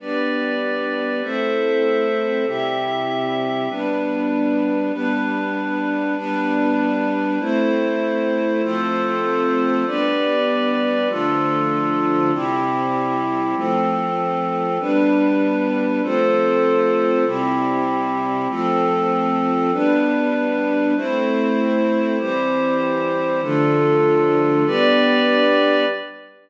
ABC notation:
X:1
M:9/8
L:1/8
Q:3/8=146
K:Gmix
V:1 name="String Ensemble 1"
[G,B,D]9 | [A,CE]9 | [C,G,E]9 | [G,B,D]9 |
[G,B,D]9 | [G,B,D]9 | [A,CE]9 | [F,A,C]9 |
[G,B,D]9 | [D,F,A,]9 | [C,G,E]9 | [F,A,C]9 |
[G,B,D]9 | [F,A,C]9 | [C,G,E]9 | [F,A,C]9 |
[G,B,D]9 | [A,CE]9 | [E,G,C]9 | [D,F,A,]9 |
[G,B,D]9 |]
V:2 name="Pad 5 (bowed)"
[GBd]9 | [Ace]9 | [CGe]9 | [G,DB]9 |
[G,DB]9 | [G,DB]9 | [A,Ec]9 | [FAc]9 |
[GBd]9 | [DFA]9 | [CEG]9 | [F,CA]9 |
[G,DB]9 | [FAc]9 | [CEG]9 | [F,CA]9 |
[G,DB]9 | [A,Ec]9 | [EGc]9 | [DFA]9 |
[GBd]9 |]